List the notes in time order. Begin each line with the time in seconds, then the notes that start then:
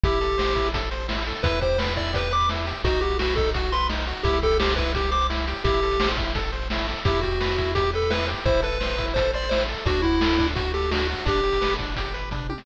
0.04 A1 E4 G4, kick, closed hi-hat
0.13 closed hi-hat
0.21 A4, closed hi-hat
0.30 closed hi-hat
0.38 C5, snare
0.48 closed hi-hat
0.55 E4, kick, closed hi-hat
0.65 closed hi-hat
0.74 A4, kick, closed hi-hat
0.83 closed hi-hat
0.91 C5, closed hi-hat
1.00 closed hi-hat
1.08 E4, snare
1.18 closed hi-hat
1.26 A4, closed hi-hat
1.35 closed hi-hat
1.43 E2 E4 B4, kick, closed hi-hat
1.53 closed hi-hat
1.61 G4 C5, kick, closed hi-hat
1.70 closed hi-hat
1.78 B4, snare
1.88 closed hi-hat
1.96 E4 D5, kick, closed hi-hat
2.05 closed hi-hat
2.13 G4 B4, kick, closed hi-hat
2.23 closed hi-hat
2.31 B4 D6, closed hi-hat
2.41 closed hi-hat
2.49 E4, snare
2.58 closed hi-hat
2.66 G4, closed hi-hat
2.76 closed hi-hat
2.84 B1 D#4 F#4, kick, closed hi-hat
2.93 closed hi-hat
3.01 F#4 G4, closed hi-hat
3.10 closed hi-hat
3.19 F#4 B4, snare
3.28 closed hi-hat
3.36 D#4 A4, kick, closed hi-hat
3.46 closed hi-hat
3.54 F#4, kick, closed hi-hat
3.63 closed hi-hat
3.72 B4 C6, closed hi-hat
3.81 closed hi-hat
3.89 D#4, snare
3.99 closed hi-hat
4.07 F#4, closed hi-hat
4.16 closed hi-hat
4.23 C2 E4 G4, kick, closed hi-hat
4.33 closed hi-hat
4.42 G4 A4, kick, closed hi-hat
4.51 closed hi-hat
4.60 G4 C5, snare
4.69 closed hi-hat
4.76 E4 B4, kick, closed hi-hat
4.86 closed hi-hat
4.95 G4, kick, closed hi-hat
5.04 closed hi-hat
5.11 C5 D6, closed hi-hat
5.21 closed hi-hat
5.30 E4, snare
5.38 closed hi-hat
5.47 G4, closed hi-hat
5.56 closed hi-hat
5.64 A1 E4 G4, kick, closed hi-hat
5.74 closed hi-hat
5.83 A4, closed hi-hat
5.91 closed hi-hat
6.00 C5, snare
6.09 closed hi-hat
6.17 E4, kick, closed hi-hat
6.27 closed hi-hat
6.35 A4, kick, closed hi-hat
6.44 closed hi-hat
6.52 C5, closed hi-hat
6.62 closed hi-hat
6.70 E4, snare
6.79 closed hi-hat
6.88 A4, closed hi-hat
6.96 closed hi-hat
7.05 E2 E4 G4, kick, closed hi-hat
7.14 closed hi-hat
7.21 F#4 G4, kick, closed hi-hat
7.31 closed hi-hat
7.40 B4, snare
7.50 closed hi-hat
7.58 E4, kick, closed hi-hat
7.66 closed hi-hat
7.75 G4, kick, closed hi-hat
7.84 closed hi-hat
7.93 A4 B4, closed hi-hat
8.02 closed hi-hat
8.10 E4 B4, snare
8.19 closed hi-hat
8.28 G4, closed hi-hat
8.37 closed hi-hat
8.45 A1 E4 C5, kick, closed hi-hat
8.54 closed hi-hat
8.62 A4 B4, closed hi-hat
8.72 closed hi-hat
8.80 C5, snare
8.89 closed hi-hat
8.98 E4, kick, closed hi-hat
9.08 closed hi-hat
9.14 A4 C5, kick, closed hi-hat
9.25 closed hi-hat
9.33 C5 D5, closed hi-hat
9.42 closed hi-hat
9.49 E4 C5, snare
9.60 closed hi-hat
9.68 A4, closed hi-hat
9.77 closed hi-hat
9.85 D2 D4 F#4, kick, closed hi-hat
9.95 closed hi-hat
10.02 E4 F#4, kick, closed hi-hat
10.12 closed hi-hat
10.21 A4, snare
10.30 closed hi-hat
10.38 D4, kick, closed hi-hat
10.48 closed hi-hat
10.55 F#4, kick, closed hi-hat
10.65 closed hi-hat
10.74 G4 A4, closed hi-hat
10.82 closed hi-hat
10.91 D4 F#4, snare
11.00 closed hi-hat
11.09 F#4, closed hi-hat
11.18 closed hi-hat
11.25 G1 D4 G4, kick, closed hi-hat
11.36 closed hi-hat
11.43 G4, closed hi-hat
11.53 closed hi-hat
11.61 B4, snare
11.70 closed hi-hat
11.79 D4, kick, closed hi-hat
11.88 closed hi-hat
11.96 G4, kick, closed hi-hat
12.05 closed hi-hat
12.14 B4, closed hi-hat
12.31 D4, kick, closed hi-hat, floor tom
12.49 G4, high tom
12.58 snare